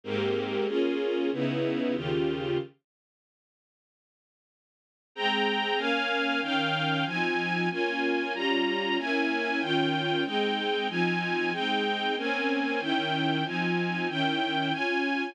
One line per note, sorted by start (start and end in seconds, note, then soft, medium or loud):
0.04 0.67 G#2 medium
0.04 0.66 A#3 medium
0.04 0.67 C4 medium
0.04 0.67 G4 medium
0.67 1.30 A#3 medium
0.67 1.30 C#4 medium
0.67 1.30 F4 medium
0.67 1.30 G#4 medium
1.32 1.94 C#3 medium
1.32 1.95 B3 medium
1.32 1.95 D#4 medium
1.32 1.95 E4 medium
1.94 2.58 D#2 medium
1.94 2.58 C#3 medium
1.94 2.58 F4 medium
1.94 2.58 G4 medium
5.15 5.79 G#3 medium
5.15 5.79 C4 medium
5.15 5.79 G5 medium
5.15 5.79 A#5 medium
5.77 6.41 A#3 medium
5.77 6.41 C#4 medium
5.77 6.41 F5 medium
5.77 6.41 G#5 medium
6.41 7.05 D#3 medium
6.41 7.05 C#4 medium
6.41 7.05 F5 medium
6.41 7.05 G5 medium
7.05 7.69 F3 medium
7.05 7.69 C4 medium
7.05 7.69 D#4 medium
7.05 7.69 G#5 medium
7.70 8.33 A#3 medium
7.70 8.33 C#4 medium
7.70 8.33 F4 medium
7.70 8.33 G#5 medium
8.34 8.97 G3 medium
8.34 8.97 C#4 medium
8.34 8.97 F4 medium
8.34 8.97 A#5 medium
8.98 9.61 A#3 medium
8.98 9.60 C#4 medium
8.98 9.61 E4 medium
8.98 9.61 G#5 medium
9.61 10.24 D#3 medium
9.61 10.24 C#4 medium
9.61 10.24 F4 medium
9.61 10.24 G5 medium
10.24 10.88 G#3 medium
10.24 10.88 C4 medium
10.24 10.88 D#4 medium
10.24 10.88 G5 medium
10.89 11.52 F3 medium
10.89 11.51 C4 medium
10.89 11.51 D#4 medium
10.89 11.52 G#5 medium
11.52 12.15 G#3 medium
11.52 12.15 C4 medium
11.52 12.15 D#4 medium
11.52 12.15 G5 medium
12.17 12.80 A#3 medium
12.17 12.80 C4 medium
12.17 12.80 C#4 medium
12.17 12.80 G#5 medium
12.80 13.44 D#3 medium
12.80 13.44 C#4 medium
12.80 13.44 E4 medium
12.80 13.44 G5 medium
13.44 14.07 F3 medium
13.44 14.07 C4 medium
13.44 14.07 D#4 medium
13.44 14.07 G#5 medium
14.09 14.72 D#3 medium
14.09 14.70 C#4 medium
14.09 14.72 E4 medium
14.09 14.72 G5 medium
14.71 15.34 C#4 medium
14.71 15.34 F4 medium
14.71 15.34 G#5 medium